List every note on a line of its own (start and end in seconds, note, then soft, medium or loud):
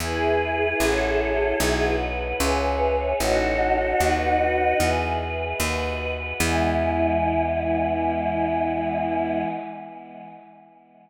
0.00 0.74 E2 medium
0.00 0.79 E4 medium
0.00 1.94 E4 medium
0.00 0.79 G#4 medium
0.00 1.94 G#4 medium
0.00 0.79 B4 medium
0.80 1.54 A1 medium
0.80 1.59 F#4 medium
0.80 1.59 A4 medium
0.80 1.59 C#5 medium
1.60 2.34 B1 medium
1.60 2.39 F#4 medium
1.60 2.39 B4 medium
1.60 2.39 D#5 medium
2.40 3.14 C#2 medium
2.40 3.19 G#4 medium
2.40 3.11 B4 medium
2.40 3.19 C#5 medium
2.40 3.19 E5 medium
3.20 3.94 A1 medium
3.20 4.88 D#4 loud
3.20 4.88 F#4 loud
3.20 3.99 F#4 medium
3.20 4.00 A4 medium
3.20 4.00 C#5 medium
4.00 4.74 D#2 medium
4.00 4.79 F#4 medium
4.00 4.79 B4 medium
4.00 4.79 D#5 medium
4.80 5.54 E2 medium
4.80 5.59 G#4 medium
4.80 5.59 B4 medium
4.80 5.59 E5 medium
5.60 6.33 D#2 medium
5.60 6.39 F#4 medium
5.60 6.39 B4 medium
5.60 6.39 D#5 medium
6.40 9.45 E2 loud
6.40 9.45 E3 loud
6.40 9.45 G#3 loud
6.40 9.45 B3 medium
6.40 9.45 E4 loud